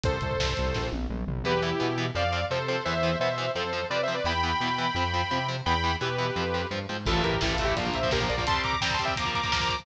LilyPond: <<
  \new Staff \with { instrumentName = "Lead 2 (sawtooth)" } { \time 4/4 \key a \phrygian \tempo 4 = 171 <a' c''>2~ <a' c''>8 r4. | \key e \phrygian <g' b'>8 <e' g'>4. <d'' f''>4 <a' c''>8 <a' c''>8 | <c'' e''>4 <c'' e''>4 <a' c''>4 \tuplet 3/2 { <b' d''>8 <c'' e''>8 <b' d''>8 } | <g'' b''>1 |
<g'' b''>4 <g' b'>2 r4 | \key a \phrygian <f' a'>8 <g' bes'>8 \tuplet 3/2 { <e' g'>8 <f' a'>8 <e' g'>8 } <d' f'>8 <c'' e''>8 <g' bes'>8 <bes' d''>8 | <a'' c'''>8 <bes'' d'''>8 \tuplet 3/2 { <g'' bes''>8 <a'' c'''>8 <e'' g''>8 } <bes'' d'''>8 <bes'' d'''>8 <bes'' d'''>8 <bes'' d'''>8 | }
  \new Staff \with { instrumentName = "Overdriven Guitar" } { \time 4/4 \key a \phrygian r1 | \key e \phrygian <e b>8 <e b>8 <e b>8 <e b>8 <f c'>8 <f c'>8 <f c'>8 <f c'>8 | <e b>8 <e b>8 <e b>8 <e b>8 <f c'>8 <f c'>8 <f c'>8 <f c'>8 | <e b>8 <e b>8 <e b>8 <e b>8 <f c'>8 <f c'>8 <f c'>8 <f c'>8 |
<e b>8 <e b>8 <e b>8 <e b>8 <f c'>8 <f c'>8 <f c'>8 <f c'>8 | \key a \phrygian <e a>4 <e a>8 <e a>8 <f bes>16 <f bes>8 <f bes>16 <f bes>16 <f bes>8 <f bes>16 | <g c'>4 <g c'>8 <g c'>8 <f bes>16 <f bes>8 <f bes>16 <f bes>16 <f bes>8 <f bes>16 | }
  \new Staff \with { instrumentName = "Synth Bass 1" } { \clef bass \time 4/4 \key a \phrygian c,8 c,8 c,8 c,8 bes,,8 bes,,8 bes,,8 bes,,8 | \key e \phrygian e,4 b,4 f,4 c4 | e,4 b,4 f,4 c4 | e,4 b,4 f,4 c4 |
e,4 b,4 f,4 g,8 aes,8 | \key a \phrygian a,,8 a,,8 a,,8 a,,8 bes,,8 bes,,8 bes,,8 bes,,8 | r1 | }
  \new DrumStaff \with { instrumentName = "Drums" } \drummode { \time 4/4 <hh bd>16 bd16 <hh bd>16 bd16 <bd sn>16 bd16 <hh bd>16 bd16 <bd sn>8 tommh8 toml8 tomfh8 | r4 r4 r4 r4 | r4 r4 r4 r4 | r4 r4 r4 r4 |
r4 r4 r4 r4 | <cymc bd>16 bd16 <hh bd>16 bd16 <bd sn>16 bd16 <hh bd>16 bd16 <hh bd>16 bd16 <hh bd>16 bd16 <bd sn>16 bd16 <hh bd>16 bd16 | <hh bd>16 bd16 <hh bd>16 bd16 <bd sn>16 bd16 <hh bd>16 bd16 <hh bd>16 bd16 <hh bd>16 bd16 <bd sn>16 bd16 <hh bd>16 bd16 | }
>>